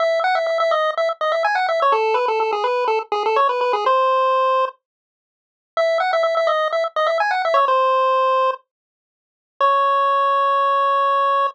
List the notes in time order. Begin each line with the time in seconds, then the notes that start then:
0.00 E5
0.24 F#5
0.35 E5
0.47 E5
0.60 E5
0.71 D#5
0.97 E5
1.21 D#5
1.32 E5
1.45 G#5
1.55 F#5
1.69 E5
1.82 C#5
1.92 A4
2.14 B4
2.28 A4
2.40 A4
2.52 G#4
2.64 B4
2.88 A4
3.12 G#4
3.26 A4
3.36 C#5
3.49 B4
3.61 B4
3.73 G#4
3.86 C5
5.77 E5
6.00 F#5
6.13 E5
6.23 E5
6.37 E5
6.47 D#5
6.73 E5
6.96 D#5
7.07 E5
7.20 G#5
7.31 F#5
7.45 E5
7.54 C#5
7.68 C5
9.61 C#5